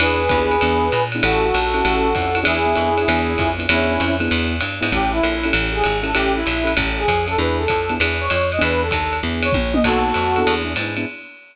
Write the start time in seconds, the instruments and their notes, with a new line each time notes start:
0.00 electric bass (finger) E2, acoustic grand piano B3 D4 E4 G#4, brass section G#4 B4, ride
0.29 electric bass (finger) D#2, acoustic grand piano B3 D4 E4 G#4, kick, hi-hat pedal, ride
0.51 ride
0.61 electric bass (finger) E2, acoustic grand piano B3 D4 E4 G#4, ride
0.92 electric bass (finger) A#2, hi-hat pedal, ride
1.12 acoustic grand piano B3 D4 E4 G#4, ride
1.23 electric bass (finger) A1, acoustic grand piano C#4 E4 G4 A4, brass section F#4 A4, ride
1.54 electric bass (finger) A#1, hi-hat pedal, ride
1.74 acoustic grand piano C#4 E4 G4 A4, ride
1.85 electric bass (finger) A1, acoustic grand piano C#4 E4 G4 A4, ride
2.15 electric bass (finger) F2, acoustic grand piano C#4 E4 G4 A4, kick, hi-hat pedal, ride
2.35 acoustic grand piano C#4 E4 G4 A4, ride
2.43 electric bass (finger) E2, acoustic grand piano B3 D4 E4 G#4, brass section E4 G#4, ride
2.66 acoustic grand piano B3 D4 E4 G#4
2.76 electric bass (finger) F2, acoustic grand piano B3 D4 E4 G#4, hi-hat pedal, ride
2.98 acoustic grand piano B3 D4 E4 G#4, ride
3.08 electric bass (finger) E2, acoustic grand piano B3 D4 E4 G#4, ride
3.38 electric bass (finger) F2, kick, hi-hat pedal, ride
3.58 acoustic grand piano B3 D4 E4 G#4, ride
3.69 electric bass (finger) E2, acoustic grand piano B3 D4 E4 G#4, brass section C#4 E4, ride
4.00 electric bass (finger) F2, hi-hat pedal, ride
4.20 acoustic grand piano B3 D4 E4 G#4, ride
4.31 electric bass (finger) E2, ride
4.60 electric bass (finger) G2, hi-hat pedal, ride
4.81 electric bass (finger) G#2, acoustic grand piano B3 D4 E4 G#4, ride
4.92 electric bass (finger) A1, acoustic grand piano C#4 E4 G4 A4, brass section G4, kick, ride
5.12 brass section E4
5.23 electric bass (finger) A#1, acoustic grand piano C#4 E4 G4 A4, hi-hat pedal, ride
5.43 acoustic grand piano C#4 E4 G4 A4, ride
5.53 electric bass (finger) A1, ride
5.72 acoustic grand piano C#4 E4 G4 A4, brass section G#4
5.83 electric bass (finger) G#1, hi-hat pedal, ride
6.03 acoustic grand piano C#4 E4 G4 A4, brass section A4, ride
6.15 electric bass (finger) A1, acoustic grand piano C#4 E4 G4 A4, brass section G4, ride
6.35 brass section E4
6.46 electric bass (finger) A#1, hi-hat pedal, ride
6.64 acoustic grand piano C#4 E4 G4 A4, ride
6.77 electric bass (finger) A1, acoustic grand piano C#4 E4 G4 A4, kick, ride
6.98 brass section G#4
7.08 electric bass (finger) F2, kick, hi-hat pedal, ride
7.27 acoustic grand piano C#4 E4 G4 A4, brass section A4, ride
7.38 electric bass (finger) E2, acoustic grand piano B3 D4 E4 G#4, brass section B4
7.58 brass section A4
7.68 electric bass (finger) F2, kick, hi-hat pedal, ride
7.89 acoustic grand piano B3 D4 E4 G#4, ride
8.00 electric bass (finger) E2, acoustic grand piano B3 D4 E4 G#4, ride
8.20 brass section C#5
8.30 electric bass (finger) F2, hi-hat pedal, ride
8.52 brass section D#5, ride
8.59 electric bass (finger) E2, acoustic grand piano B3 D4 E4 G#4, brass section B4, ride
8.82 brass section A4
8.91 electric bass (finger) D#2, kick, hi-hat pedal, ride
9.13 ride
9.23 electric bass (finger) E2, acoustic grand piano B3 D4 E4 G#4
9.43 brass section C#5, ride
9.52 electric bass (finger) A#1, kick, high tom
9.74 acoustic grand piano B3 D4 E4 G#4, brass section D#5, high tom
9.84 electric bass (finger) B1, acoustic grand piano B3 D#4 F#4 A4, brass section F#4 A4, kick, crash, ride
10.14 electric bass (finger) F2, hi-hat pedal, ride
10.36 acoustic grand piano B3 D4 E4 G#4, ride
10.47 electric bass (finger) E2, ride
10.65 acoustic grand piano B3 D4 E4 G#4
10.76 electric bass (finger) G#2, acoustic grand piano B3 D4 E4 G#4, hi-hat pedal, ride
10.97 acoustic grand piano B3 D4 E4 G#4, ride